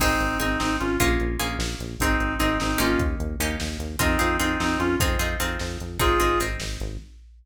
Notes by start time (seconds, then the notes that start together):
0.00 G#1 C4 D#4 G#4, kick, crash
0.20 G#1, closed hi-hat
0.40 G#1 C4 D#4 G#4, closed hi-hat
0.59 G#1 C4 D#4, snare
0.80 G#1 C#4 F4, closed hi-hat
1.00 A#1 A#3 C#4 F4 G#4, kick, closed hi-hat
1.20 A#1, closed hi-hat
1.39 A#1 A#3 C#4 F4 G#4, closed hi-hat
1.59 A#1, snare
1.79 A#1, closed hi-hat
2.00 G#1 C4 D#4 G#4, kick, closed hi-hat
2.20 G#1, closed hi-hat
2.39 G#1 C4 D#4 G#4, closed hi-hat
2.60 G#1 C4 D#4, snare
2.78 G#1 A#3 C#4 D#4 F4 G4, closed hi-hat
2.99 D#2, kick, closed hi-hat
3.20 D#2, closed hi-hat
3.40 D#2 A#3 C#4 D#4 G4, closed hi-hat
3.60 D#2, snare
3.79 D#2, closed hi-hat
3.99 F2 C4 D#4 F4 G#4, kick, closed hi-hat
4.19 F2 C4 D#4 F4 G#4, closed hi-hat
4.39 F2 C4 D#4 F4 G#4, closed hi-hat
4.60 F2 C4 D#4, snare
4.79 F2 C#4 F4, closed hi-hat
4.99 F2 C4 D#4 F4 G#4, kick, closed hi-hat
5.19 F2 C4 D#4 F4 G#4, closed hi-hat
5.40 F2 C4 D#4 F4 G#4, closed hi-hat
5.59 F2, snare
5.80 F2, closed hi-hat
5.99 G#1 C4 D#4 F4 G#4, kick, closed hi-hat
6.20 G#1 C4 D#4 G#4, closed hi-hat
6.40 G#1 C4 D#4 G#4, closed hi-hat
6.60 G#1, snare
6.80 G#1, closed hi-hat